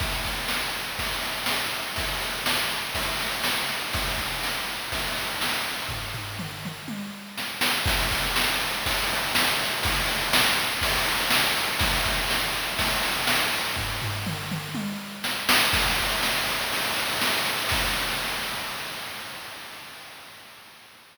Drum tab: CC |----------------|----------------|----------------|----------------|
RD |x-x---x-x-x---x-|x-x---x-x-x---x-|x-x---x-x-x---x-|----------------|
SD |----o-----o-o---|----o-----o-o---|----o-----o-o---|------------o-o-|
T1 |----------------|----------------|----------------|--------o-------|
T2 |----------------|----------------|----------------|----o-o---------|
FT |----------------|----------------|----------------|o-o-------------|
BD |o-o-----o-------|o-------o-------|o-o-----o-------|o---------------|

CC |----------------|----------------|----------------|----------------|
RD |x-x---x-x-x---x-|x-x---x-x-x---x-|x-x---x-x-x---x-|----------------|
SD |----o-----o-o---|----o-----o-o---|----o-----o-o---|------------o-o-|
T1 |----------------|----------------|----------------|--------o-------|
T2 |----------------|----------------|----------------|----o-o---------|
FT |----------------|----------------|----------------|o-o-------------|
BD |o-o-----o-------|o-------o-------|o-o-----o-------|o---------------|

CC |x---------------|x---------------|
RD |-xxx-xxxxxxx-xxx|----------------|
SD |----o-----o-o---|----------------|
T1 |----------------|----------------|
T2 |----------------|----------------|
FT |----------------|----------------|
BD |o-o-------------|o---------------|